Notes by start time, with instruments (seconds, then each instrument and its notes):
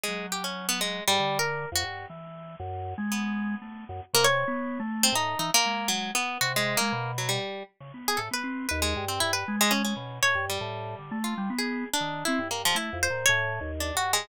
0.03 orchestral harp G#3
0.08 drawbar organ F#3
0.32 orchestral harp G4
0.44 orchestral harp C#4
0.69 orchestral harp B3
0.81 orchestral harp G#3
1.08 drawbar organ G#2, orchestral harp G3
1.20 drawbar organ D3
1.39 orchestral harp A#4
1.72 drawbar organ F2, orchestral harp F#4
1.83 drawbar organ G2
2.10 drawbar organ E3
2.60 drawbar organ F#2
2.98 drawbar organ G#3
3.12 orchestral harp B3
3.62 drawbar organ A3
3.89 drawbar organ F#2
4.13 drawbar organ C3, orchestral harp A#3
4.24 orchestral harp C#5
4.48 drawbar organ B3
4.80 drawbar organ A3
5.03 orchestral harp C4
5.12 drawbar organ A2, orchestral harp D#4
5.39 drawbar organ E3, orchestral harp D#4
5.54 orchestral harp A#3
5.65 drawbar organ G#3
5.88 orchestral harp F#3
6.15 orchestral harp B3
6.41 drawbar organ C3, orchestral harp F#4
6.56 orchestral harp G#3
6.77 drawbar organ G#3, orchestral harp A#3
6.92 drawbar organ B2
7.18 orchestral harp F#3
7.29 orchestral harp G3
7.80 drawbar organ C#3
7.94 drawbar organ B3
8.08 orchestral harp G#4
8.17 drawbar organ A2, orchestral harp A4
8.31 drawbar organ B3, orchestral harp B4
8.44 drawbar organ C4
8.69 drawbar organ D#2, orchestral harp B4
8.82 orchestral harp G#3
8.96 drawbar organ G2
9.08 orchestral harp C4
9.20 drawbar organ G2, orchestral harp E4
9.33 orchestral harp B4
9.48 drawbar organ G#3
9.61 orchestral harp G#3
9.71 orchestral harp C#4
9.85 orchestral harp C#4
9.96 drawbar organ B2
10.23 drawbar organ A2, orchestral harp C#5
10.35 drawbar organ G2
10.50 orchestral harp G3
10.61 drawbar organ A2
10.99 drawbar organ D3
11.11 drawbar organ A3
11.24 orchestral harp F4
11.38 drawbar organ G3
11.50 drawbar organ B3
11.58 orchestral harp G#4
11.94 orchestral harp D4
12.01 drawbar organ D#3
12.25 drawbar organ C4, orchestral harp E4
12.39 drawbar organ G2
12.51 orchestral harp A#3
12.65 orchestral harp F3
12.75 drawbar organ A3, orchestral harp E4
12.93 drawbar organ F2
13.03 orchestral harp C5
13.10 drawbar organ A#2
13.26 drawbar organ A2, orchestral harp C#5
13.61 drawbar organ D#2
13.80 orchestral harp D4
13.95 drawbar organ G2, orchestral harp F#4
14.13 orchestral harp G#3